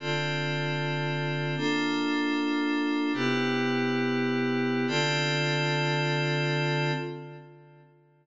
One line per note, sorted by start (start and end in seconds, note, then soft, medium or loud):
0.00 1.55 D3 medium
0.00 1.55 C4 medium
0.00 1.55 F4 medium
0.00 1.55 A4 medium
1.57 3.12 A#3 medium
1.57 3.12 D4 medium
1.57 3.12 F4 medium
1.57 3.12 A4 medium
3.14 4.86 C3 medium
3.14 4.86 B3 medium
3.14 4.86 E4 medium
3.14 4.86 G4 medium
4.88 6.92 D3 medium
4.88 6.92 C4 medium
4.88 6.92 F4 loud
4.88 6.92 A4 loud